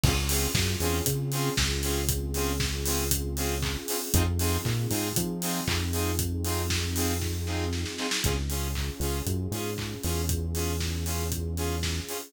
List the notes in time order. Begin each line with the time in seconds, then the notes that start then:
0.04 C#2 C4 C#4 F4 G#4, kick, crash
0.29 C4 C#4 F4 G#4, open hi-hat
0.54 F#2, kick, snare
0.80 E2 C4 C#4 F4 G#4, open hi-hat
1.06 C#3, kick, closed hi-hat
1.32 C4 C#4 F4 G#4, open hi-hat
1.57 C#2, kick, snare
1.83 C4 C#4 F4 G#4, open hi-hat
2.09 kick, closed hi-hat
2.34 C4 C#4 F4 G#4, open hi-hat
2.60 kick, snare
2.86 C4 C#4 F4 G#4, open hi-hat
3.11 kick, closed hi-hat
3.37 C4 C#4 F4 G#4, open hi-hat
3.63 kick, clap
3.88 C4 C#4 F4 G#4, open hi-hat
4.14 F2 C4 D#4 F4 G#4, kick, closed hi-hat
4.39 C4 D#4 F4 G#4, open hi-hat
4.65 A#2, kick, clap
4.90 G#2 C4 D#4 F4 G#4, open hi-hat
5.16 F3, kick, closed hi-hat
5.42 C4 D#4 F4 G#4, open hi-hat
5.67 F2, kick, clap
5.93 C4 D#4 F4 G#4, open hi-hat
6.19 kick, closed hi-hat
6.45 C4 D#4 F4 G#4, open hi-hat
6.70 kick, snare
6.96 C4 D#4 F4 G#4, open hi-hat
7.21 kick, snare
7.47 C4 D#4 F4 G#4, snare
7.73 snare
7.86 snare
7.98 C4 D#4 F4 G#4, snare
8.11 snare
8.24 C#2 C#4 F4 G#4, kick, closed hi-hat
8.50 C#4 F4 G#4, open hi-hat
8.75 kick, clap
9.00 C#2 C#4 F4 G#4, open hi-hat
9.26 F#2, kick, closed hi-hat
9.51 G#2 C#4 F4 G#4, open hi-hat
9.78 kick, clap
10.04 E2 C#4 F4 G#4, open hi-hat
10.29 kick, closed hi-hat
10.55 C#4 F4 G#4, open hi-hat
10.80 kick, snare
11.06 C#4 F4 G#4, open hi-hat
11.32 kick, closed hi-hat
11.57 C#4 F4 G#4, open hi-hat
11.83 kick, snare
12.08 C#4 F4 G#4, open hi-hat